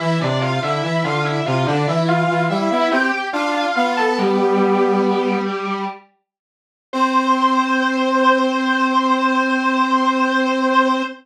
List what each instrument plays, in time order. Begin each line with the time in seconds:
0.00 brass section E3, lead 1 (square) E4 E5
0.21 brass section C3, lead 1 (square) D4 D5
0.41 lead 1 (square) F4 F5
0.62 brass section D3, lead 1 (square) E4 E5
0.83 brass section E3, lead 1 (square) E4 E5
1.04 brass section D3, lead 1 (square) F4 F5
1.25 lead 1 (square) E4 E5
1.46 brass section C3, lead 1 (square) F4 F5
1.66 brass section D3, lead 1 (square) D4 D5
1.87 brass section E3, lead 1 (square) E4 E5
2.08 lead 1 (square) F4 F5
2.29 brass section E3
2.49 brass section G3, lead 1 (square) E4 E5
2.71 brass section B3, lead 1 (square) E4 E5
2.91 brass section C4, lead 1 (square) G4 G5
3.32 brass section D4, lead 1 (square) F4 F5
3.54 lead 1 (square) F4 F5
3.75 brass section B3, lead 1 (square) F4 F5
3.97 lead 1 (square) A4 A5
4.18 lead 1 (square) G3 G4
6.93 brass section C4, lead 1 (square) C5